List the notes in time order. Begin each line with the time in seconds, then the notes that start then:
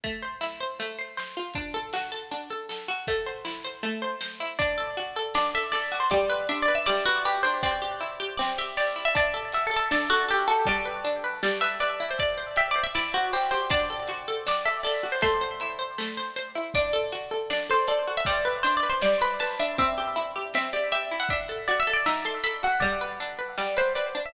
0.04 A3, kick, closed hi-hat
0.22 C5
0.41 E4, snare
0.60 C5
0.80 A3, closed hi-hat
0.99 C5
1.17 C5, snare
1.37 F4
1.54 D4, kick, closed hi-hat
1.74 A4
1.93 F#4, snare
2.12 A4
2.31 D4, closed hi-hat
2.50 A4
2.69 A4, snare
2.88 F#4
3.07 A3, kick, closed hi-hat
3.26 C5
3.45 E4, snare
3.64 C5
3.83 A3, closed hi-hat
4.02 C5
4.21 C5, snare
4.40 E4
4.59 D4 D5, kick, closed hi-hat
4.78 A4
4.97 F#4, closed hi-hat
5.16 A4
5.34 D4 D5, snare
5.55 A4 E5
5.72 A4 D5, open hi-hat
5.92 F#4
6.00 C5
6.10 G3 D5, kick, closed hi-hat
6.30 B4
6.49 D4 E5, closed hi-hat
6.62 D5
6.68 B4
6.75 E5
6.86 G3 D5, snare
7.05 F#4 B4
7.25 G4 B4, closed hi-hat
7.43 D4 C5
7.63 C4 D5, kick, closed hi-hat
7.82 G4
8.01 E4, closed hi-hat
8.20 G4
8.37 C4 D5, snare
8.58 G4 E5
8.77 G4 D5, open hi-hat
8.96 E4
9.05 E5
9.15 D4 D5, kick, closed hi-hat
9.34 A4
9.52 F#4 E5, closed hi-hat
9.67 A4
9.71 A4
9.76 A4
9.91 D4 D5, snare
10.10 F#4 A4
10.28 G4 A4, closed hi-hat
10.48 F#4 A4
10.66 G3 D5, kick, closed hi-hat
10.85 B4
11.05 D4, closed hi-hat
11.24 B4
11.43 G3 D5, snare
11.61 B4 E5
11.80 B4 D5, closed hi-hat
12.00 E4
12.11 C5
12.19 D5, kick, closed hi-hat
12.38 C5
12.56 G4 E5, closed hi-hat
12.71 D5
12.76 C5
12.84 E5
12.95 E4 D5, snare
13.14 F#4 C5
13.33 G4 C5, open hi-hat
13.51 G4 C5
13.70 D4 D5, kick, closed hi-hat
13.90 A4
14.08 F#4, closed hi-hat
14.28 A4
14.47 D4 D5, snare
14.65 A4 E5
14.83 A4 D5, open hi-hat
15.03 F#4
15.12 C5
15.21 A3 C5, kick, closed hi-hat
15.41 C5
15.60 E4, closed hi-hat
15.79 C5
15.98 A3, snare
16.17 C5
16.36 C5, closed hi-hat
16.55 E4
16.74 D4 D5, kick, closed hi-hat
16.93 A4
17.12 F#4, closed hi-hat
17.31 A4
17.50 D4 D5, snare
17.70 A4 C5
17.88 A4 D5, closed hi-hat
18.07 F#4
18.17 E5
18.25 G3 D5, kick, closed hi-hat
18.45 B4
18.63 D4 C5, closed hi-hat
18.77 D5
18.83 B4
18.90 C5
19.01 G3 D5, snare
19.21 B4 B5
19.39 B4 A5, open hi-hat
19.59 D4 E5
19.78 C4 E5, kick, closed hi-hat
19.98 G4
20.16 E4, closed hi-hat
20.36 G4
20.54 C4 E5, snare
20.73 G4 D5
20.92 G4 E5, closed hi-hat
21.11 E4
21.20 F#5
21.29 D4 E5, kick, closed hi-hat
21.49 A4
21.68 F#4 D5, closed hi-hat
21.80 E5
21.87 A4
21.93 D5
22.06 D#4 E5, snare
22.25 A4 C6
22.44 A4 B5, closed hi-hat
22.63 F#4 F#5
22.80 G3 D5, kick, closed hi-hat
23.01 B4
23.20 D4, closed hi-hat
23.39 B4
23.58 G3 D5, snare
23.77 B4 C5
23.95 B4 D5, closed hi-hat
24.15 D4
24.26 E5